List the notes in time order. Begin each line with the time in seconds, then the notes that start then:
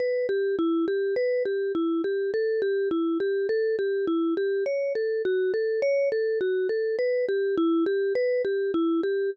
0.00 B4
0.29 G4
0.59 E4
0.88 G4
1.16 B4
1.45 G4
1.75 E4
2.04 G4
2.34 A4
2.62 G4
2.91 E4
3.20 G4
3.49 A4
3.79 G4
4.07 E4
4.37 G4
4.66 C#5
4.95 A4
5.25 F#4
5.54 A4
5.82 C#5
6.12 A4
6.41 F#4
6.69 A4
6.99 B4
7.29 G4
7.58 E4
7.86 G4
8.15 B4
8.45 G4
8.74 E4
9.03 G4